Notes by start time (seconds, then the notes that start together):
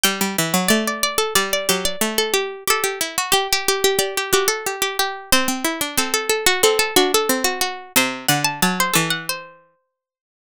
0.04 G3 G5
0.21 G3
0.38 E3
0.54 F#3
0.68 A3 D5
0.88 D5
1.03 D5
1.18 A4
1.35 G3 D5
1.53 D5
1.69 F#3 G4
1.85 D5
2.01 A3
2.18 A4
2.34 G4
2.67 G4 A4
2.84 G4
3.01 E4
3.18 F#4
3.32 G4
3.53 G4
3.68 G4
3.84 G4
3.99 G4 D5
4.17 G4
4.33 F#4 G4
4.48 A4
4.66 G4
4.82 G4
4.99 G4
5.32 C4 C5
5.48 C4
5.65 E4
5.81 D4
5.98 C4 A4
6.14 A4
6.29 A4
6.46 F#4
6.63 C4 A4
6.79 A4
6.96 D4 F#4
7.14 A4
7.29 C4
7.44 F#4
7.61 F#4
7.96 C3 C5
8.28 D3 F#5
8.45 A5
8.62 F#3 A5
8.80 C5
8.94 E3 A4
9.10 F#5
9.29 C5